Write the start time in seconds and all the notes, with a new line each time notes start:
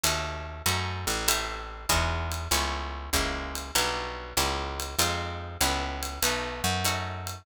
0.03 D#2 A3 C#4 D#4 F#4, ride
0.66 F#2 A3 C#4 D#4 F#4, hi-hat pedal, ride
1.07 A1, ride
1.28 A3 C4 E4 G4, ride
1.89 E2 G#3 D#4 E4 F#4, kick, hi-hat pedal, ride
2.32 ride
2.51 C#2 A3 B3 C#4 E4, ride
3.13 C#2 G#3 A#3 C#4 E4, kick, hi-hat pedal, ride
3.55 ride
3.75 B1 F#3 G3 D4 E4, ride
4.37 C#2 G#3 A#3 C#4 E4, hi-hat pedal, ride
4.80 ride
4.99 F2 G#3 C4 D#4 F4, ride
5.61 C#2 A3 B3 C#4 E4, hi-hat pedal, ride
6.03 ride
6.22 B1 A3 B3 D#4 F#4, ride
6.64 F#2
6.85 A3 C#4 D#4 F#4, hi-hat pedal, ride
7.27 ride